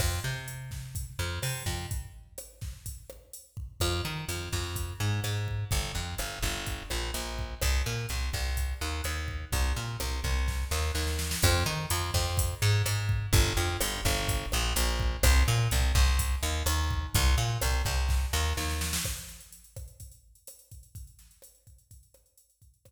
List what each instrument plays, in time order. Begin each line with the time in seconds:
0.00 electric bass (finger) F2, kick, cross-stick, crash
0.24 electric bass (finger) C3
0.48 closed hi-hat
0.71 kick, snare
0.95 kick, closed hi-hat
1.19 electric bass (finger) F2
1.42 electric bass (finger) C3, cross-stick, open hi-hat
1.66 electric bass (finger) F2, kick
1.91 kick, closed hi-hat
2.38 cross-stick, closed hi-hat
2.61 kick, snare
2.86 kick, closed hi-hat
3.10 cross-stick
3.33 closed hi-hat
3.57 kick
3.80 electric bass (finger) F2, kick, cross-stick, closed hi-hat
4.05 electric bass (finger) D#3
4.28 electric bass (finger) F2, closed hi-hat
4.52 electric bass (finger) F2, kick, snare
4.76 kick, closed hi-hat
5.00 electric bass (finger) G#2
5.24 electric bass (finger) G#2, cross-stick, closed hi-hat
5.48 kick
5.71 electric bass (finger) G1, kick, closed hi-hat
5.95 electric bass (finger) F2
6.18 electric bass (finger) G1, cross-stick, closed hi-hat
6.42 electric bass (finger) G1, kick, snare
6.66 kick, closed hi-hat
6.90 electric bass (finger) A#1, cross-stick
7.14 electric bass (finger) A#1, closed hi-hat
7.39 kick
7.62 electric bass (finger) C2, kick, cross-stick, closed hi-hat
7.86 electric bass (finger) A#2
8.09 electric bass (finger) C2, closed hi-hat
8.33 electric bass (finger) C2, kick, snare
8.57 kick, closed hi-hat
8.81 electric bass (finger) D#2
9.04 electric bass (finger) D#2, cross-stick, closed hi-hat
9.28 kick
9.52 electric bass (finger) C2, kick, closed hi-hat
9.76 electric bass (finger) A#2
10.00 electric bass (finger) C2, cross-stick, closed hi-hat
10.24 electric bass (finger) C2, kick, snare
10.48 kick, snare
10.71 electric bass (finger) D#2, snare
10.95 electric bass (finger) D#2, snare
11.07 snare
11.19 snare
11.31 snare
11.42 electric bass (finger) F2, kick, cross-stick, closed hi-hat
11.66 electric bass (finger) D#3
11.90 electric bass (finger) F2, closed hi-hat
12.14 electric bass (finger) F2, kick, snare
12.37 kick, closed hi-hat
12.62 electric bass (finger) G#2
12.86 electric bass (finger) G#2, cross-stick, closed hi-hat
13.09 kick
13.33 electric bass (finger) G1, kick, closed hi-hat
13.57 electric bass (finger) F2
13.81 electric bass (finger) G1, cross-stick, closed hi-hat
14.05 electric bass (finger) G1, kick, snare
14.28 kick, closed hi-hat
14.52 electric bass (finger) A#1, cross-stick
14.76 electric bass (finger) A#1, closed hi-hat
15.00 kick
15.23 electric bass (finger) C2, kick, cross-stick, closed hi-hat
15.48 electric bass (finger) A#2
15.71 electric bass (finger) C2, closed hi-hat
15.95 electric bass (finger) C2, kick, snare
16.19 kick, closed hi-hat
16.43 electric bass (finger) D#2
16.66 electric bass (finger) D#2, cross-stick, closed hi-hat
16.91 kick
17.14 electric bass (finger) C2, kick, closed hi-hat
17.38 electric bass (finger) A#2
17.62 electric bass (finger) C2, cross-stick, closed hi-hat
17.85 electric bass (finger) C2, kick, snare
18.09 kick, snare
18.33 electric bass (finger) D#2, snare
18.57 electric bass (finger) D#2, snare
18.70 snare
18.81 snare
18.93 snare
19.04 kick, cross-stick, crash
19.17 closed hi-hat
19.28 snare, closed hi-hat
19.40 closed hi-hat
19.52 closed hi-hat
19.64 closed hi-hat
19.76 kick, cross-stick, closed hi-hat
19.88 closed hi-hat
20.00 kick, closed hi-hat
20.12 closed hi-hat
20.35 closed hi-hat
20.47 cross-stick, closed hi-hat
20.59 closed hi-hat
20.71 kick, closed hi-hat
20.83 closed hi-hat
20.95 kick, closed hi-hat
21.07 closed hi-hat
21.19 snare, closed hi-hat
21.31 closed hi-hat
21.42 cross-stick, closed hi-hat
21.55 closed hi-hat
21.67 kick, closed hi-hat
21.78 closed hi-hat
21.91 kick, closed hi-hat
22.03 closed hi-hat
22.14 cross-stick, closed hi-hat
22.26 closed hi-hat
22.37 closed hi-hat
22.50 closed hi-hat
22.62 kick, closed hi-hat
22.74 closed hi-hat
22.85 kick, cross-stick, closed hi-hat